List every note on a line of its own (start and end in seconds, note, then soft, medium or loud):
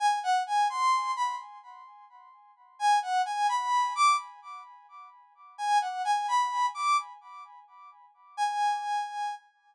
0.00 0.19 G#5 loud
0.23 0.43 F#5 medium
0.47 0.68 G#5 loud
0.70 1.11 C6 loud
1.16 1.35 B5 medium
2.79 2.99 G#5 loud
3.02 3.22 F#5 medium
3.26 3.47 G#5 loud
3.49 3.93 B5 loud
3.95 4.17 D6 loud
5.58 5.78 G#5 loud
5.81 6.02 F#5 medium
6.05 6.26 G#5 loud
6.28 6.66 B5 medium
6.74 6.97 D6 loud
8.37 9.35 G#5 loud